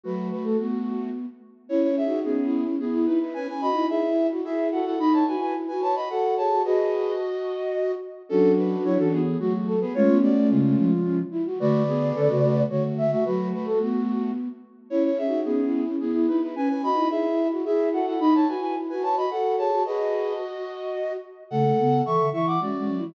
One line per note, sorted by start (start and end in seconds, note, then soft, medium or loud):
0.03 0.31 F#3 medium
0.03 1.09 A3 medium
0.03 1.09 F#4 medium
0.03 0.28 B4 loud
0.31 0.44 B4 medium
0.44 0.57 A3 medium
0.44 0.57 A4 medium
0.59 1.26 B3 medium
0.59 1.10 F#4 medium
1.69 2.00 C#4 medium
1.69 1.82 E4 medium
1.69 1.87 E4 loud
1.69 1.82 C#5 medium
1.83 1.96 E4 medium
1.83 1.96 C#5 medium
1.87 2.04 C#4 loud
1.97 2.19 G#4 medium
1.97 2.19 E5 medium
2.04 2.39 D#4 medium
2.04 2.24 F#4 medium
2.24 2.64 B3 medium
2.24 2.59 C#4 loud
2.24 2.64 G#4 medium
2.44 2.75 E4 medium
2.65 2.78 C#4 medium
2.79 3.06 B3 medium
2.79 3.18 E4 medium
2.79 3.06 G#4 medium
2.93 3.06 E4 loud
3.06 3.19 D#4 medium
3.06 3.34 E4 loud
3.06 3.19 B4 medium
3.20 3.33 D#4 soft
3.20 3.34 E4 medium
3.20 3.33 B4 medium
3.34 3.47 C#4 loud
3.34 3.70 C#4 medium
3.34 3.47 B4 medium
3.34 3.47 G#5 medium
3.48 3.61 B4 medium
3.48 3.61 G#5 medium
3.61 3.75 F#4 loud
3.61 3.86 D#5 medium
3.61 3.86 B5 medium
3.70 4.04 D#4 medium
3.74 3.87 E4 loud
3.89 4.27 E4 medium
3.89 4.27 G#4 medium
3.89 4.27 E5 medium
4.08 4.41 E4 medium
4.31 4.44 F#4 medium
4.44 4.80 E4 medium
4.44 4.69 G#4 medium
4.44 4.68 G#4 medium
4.44 4.68 E5 medium
4.72 4.94 F#4 loud
4.72 4.85 A4 medium
4.72 4.85 F#5 medium
4.85 4.98 E4 medium
4.85 4.99 A4 medium
4.85 4.99 F#5 medium
4.98 5.24 D#4 loud
4.98 5.36 D#4 medium
4.98 5.13 D#5 medium
4.98 5.13 B5 medium
5.13 5.26 C#5 medium
5.13 5.26 A5 medium
5.27 5.55 F#4 loud
5.27 5.40 B4 medium
5.27 5.40 G#5 medium
5.35 5.68 E4 medium
5.41 5.54 B4 medium
5.41 5.54 G#5 medium
5.68 5.82 F#4 medium
5.68 5.81 B4 medium
5.68 5.81 G#5 medium
5.73 6.05 F#4 medium
5.81 5.94 B4 medium
5.81 5.95 C#5 medium
5.81 5.95 A5 medium
5.95 6.08 F#4 medium
5.95 6.08 D#5 medium
5.95 6.08 B5 medium
6.09 6.49 F#4 medium
6.09 6.35 A4 medium
6.09 6.35 F#5 medium
6.37 6.61 G#4 medium
6.37 6.62 C#5 medium
6.37 6.62 A5 medium
6.50 6.63 F#4 medium
6.64 7.95 F#4 medium
6.64 7.92 F#4 medium
6.64 7.12 G#4 loud
6.64 7.12 B4 loud
6.64 7.92 D#5 medium
8.29 8.76 F#3 medium
8.29 8.51 C#4 medium
8.29 9.21 D4 loud
8.29 9.21 F#4 loud
8.29 8.51 A4 medium
8.57 8.83 D4 medium
8.57 8.83 B4 medium
8.84 8.97 F#3 medium
8.84 8.98 E4 medium
8.84 8.98 C#5 medium
8.98 9.37 E3 medium
8.98 9.12 C#4 medium
8.98 9.12 A4 medium
9.12 9.37 B3 medium
9.12 9.37 G#4 medium
9.39 9.84 F#3 medium
9.39 9.75 A3 medium
9.39 9.75 F#4 medium
9.39 9.53 F#4 loud
9.67 9.80 A4 loud
9.81 9.94 B3 medium
9.81 9.94 G#4 medium
9.81 9.94 B4 loud
9.94 10.08 G#3 loud
9.94 10.91 A3 loud
9.94 10.91 C#4 loud
9.94 10.17 F4 medium
9.94 10.17 C#5 loud
10.08 10.33 B3 medium
10.22 10.49 F#4 medium
10.22 10.49 D5 medium
10.38 10.51 A3 medium
10.50 10.76 C#3 medium
10.50 11.19 G#3 medium
10.50 11.19 F4 medium
10.77 11.22 F3 medium
11.04 11.17 C#4 loud
11.31 11.44 E4 loud
11.46 11.59 F#4 loud
11.60 12.12 D3 medium
11.60 11.83 A3 medium
11.60 11.83 F#4 loud
11.60 12.62 B4 loud
11.60 12.62 D5 loud
11.88 12.13 B3 medium
11.88 12.13 G#4 medium
12.15 12.29 D3 medium
12.15 12.28 C#4 medium
12.15 12.28 A4 medium
12.29 12.64 C#3 medium
12.29 12.42 A3 medium
12.29 12.42 F#4 medium
12.43 12.65 A3 medium
12.43 12.65 F#4 medium
12.69 13.15 D3 medium
12.69 13.06 A3 medium
12.69 13.06 F#4 medium
12.69 12.83 C#5 loud
12.98 13.11 E5 loud
13.11 13.24 A3 medium
13.11 13.24 F#4 medium
13.11 13.25 E5 loud
13.25 13.53 F#3 medium
13.25 14.31 A3 medium
13.25 14.31 F#4 medium
13.25 13.48 B4 loud
13.53 13.66 B4 loud
13.65 13.78 A3 medium
13.65 13.79 A4 loud
13.81 14.48 B3 medium
13.81 14.32 F#4 loud
14.90 15.22 C#4 medium
14.90 15.03 E4 medium
14.90 15.08 E4 loud
14.90 15.03 C#5 medium
15.04 15.18 E4 medium
15.04 15.18 C#5 medium
15.10 15.27 C#4 loud
15.18 15.40 G#4 medium
15.18 15.40 E5 medium
15.26 15.61 D#4 medium
15.26 15.44 F#4 medium
15.45 15.84 B3 medium
15.45 15.80 C#4 loud
15.45 15.84 G#4 medium
15.64 15.96 E4 medium
15.86 15.99 C#4 medium
16.00 16.26 B3 medium
16.00 16.38 E4 medium
16.00 16.26 G#4 medium
16.14 16.27 E4 loud
16.28 16.41 D#4 medium
16.28 16.55 E4 loud
16.28 16.41 B4 medium
16.42 16.55 D#4 soft
16.42 16.55 E4 medium
16.42 16.55 B4 medium
16.55 16.90 C#4 medium
16.55 16.68 C#4 loud
16.55 16.68 B4 medium
16.55 16.68 G#5 medium
16.69 16.82 B4 medium
16.69 16.82 G#5 medium
16.83 16.96 F#4 loud
16.83 17.08 D#5 medium
16.83 17.08 B5 medium
16.92 17.26 D#4 medium
16.92 17.09 E4 loud
17.10 17.48 E4 medium
17.10 17.48 G#4 medium
17.10 17.48 E5 medium
17.31 17.63 E4 medium
17.51 17.64 F#4 medium
17.65 18.00 E4 medium
17.65 17.90 G#4 medium
17.65 17.89 G#4 medium
17.65 17.89 E5 medium
17.92 18.15 F#4 loud
17.92 18.06 A4 medium
17.92 18.06 F#5 medium
18.06 18.19 E4 medium
18.06 18.20 A4 medium
18.06 18.20 F#5 medium
18.19 18.44 D#4 loud
18.19 18.54 D#4 medium
18.19 18.33 D#5 medium
18.19 18.33 B5 medium
18.34 18.47 C#5 medium
18.34 18.47 A5 medium
18.48 18.75 F#4 loud
18.48 18.61 B4 medium
18.48 18.61 G#5 medium
18.57 18.91 E4 medium
18.62 18.75 B4 medium
18.62 18.75 G#5 medium
18.89 19.03 F#4 medium
18.89 19.02 B4 medium
18.89 19.02 G#5 medium
18.94 19.26 F#4 medium
19.02 19.15 B4 medium
19.02 19.16 C#5 medium
19.02 19.16 A5 medium
19.17 19.30 F#4 medium
19.17 19.30 D#5 medium
19.17 19.30 B5 medium
19.31 19.70 F#4 medium
19.31 19.56 A4 medium
19.31 19.56 F#5 medium
19.58 19.81 G#4 medium
19.58 19.83 C#5 medium
19.58 19.83 A5 medium
19.71 19.84 F#4 medium
19.85 21.13 F#4 medium
19.85 21.17 F#4 medium
19.85 20.34 G#4 loud
19.85 20.34 B4 loud
19.85 21.13 D#5 medium
21.50 21.73 C#3 medium
21.50 21.64 A3 loud
21.50 22.02 A4 medium
21.50 22.02 F#5 medium
21.65 21.78 A3 medium
21.78 22.02 C#3 medium
21.78 22.01 B3 medium
22.04 22.19 E3 medium
22.04 22.26 A4 medium
22.04 22.29 E5 medium
22.04 22.29 C#6 medium
22.19 22.32 D3 medium
22.32 22.58 E3 medium
22.32 22.56 E4 medium
22.32 22.46 E5 medium
22.32 22.46 C#6 medium
22.47 22.60 F#5 medium
22.47 22.60 D6 medium
22.60 22.73 G#3 medium
22.60 22.78 C#4 medium
22.60 23.05 F#4 medium
22.60 23.05 D5 medium
22.76 22.89 G#3 medium
22.76 22.96 C#4 medium
22.88 23.01 F#3 medium
22.98 23.14 E4 medium
23.03 23.14 E3 medium